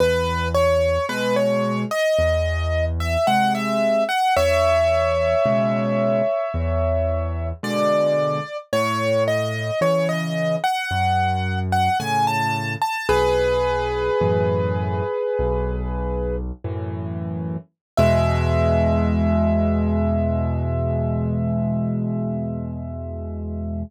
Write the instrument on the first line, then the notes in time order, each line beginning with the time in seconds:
acoustic grand piano
0.00 E2 B4
0.55 C#5
1.09 B2 G#3 B4
1.36 C#5
1.91 D#5
2.19 E2
3.00 E5
3.27 C3 G#3 F#5
3.55 E5
4.09 F#5
4.37 E2 C#5 E5
5.46 B2 C#3 G#3
6.54 E2
7.63 B2 D3 G#3 D5
8.73 A2 C#5
9.28 D#5
9.81 C#3 E3 C#5
10.09 D#5
10.64 F#5
10.91 F#2
11.72 F#5
12.00 A2 C#3 G#5
12.27 A5
12.82 A5
13.09 B1 G#4 B4
14.21 F#2 A2 E3
15.39 B1
16.64 F#2 A2 E3
17.98 E2 B2 G#3 E5